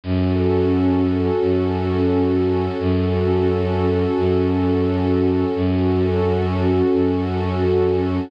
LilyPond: <<
  \new Staff \with { instrumentName = "Pad 2 (warm)" } { \time 4/4 \key fis \phrygian \tempo 4 = 87 <cis' fis' a'>1 | <cis' fis' a'>1 | <cis' fis' a'>1 | }
  \new Staff \with { instrumentName = "Violin" } { \clef bass \time 4/4 \key fis \phrygian fis,2 fis,2 | fis,2 fis,2 | fis,2 fis,2 | }
>>